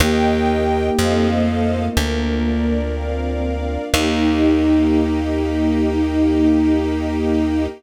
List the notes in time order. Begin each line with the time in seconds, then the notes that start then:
0.00 D#2 A#3 D#4 G4 A#4 D#5 G5
0.97 F2 A3 C4 D#4 F4 A4 C5 D#5 F5
1.96 D2 A#3 D4 F4 A#4
2.45 D5
2.94 C4 F5
3.43 D5
3.92 D#2 A#3 D#4 G4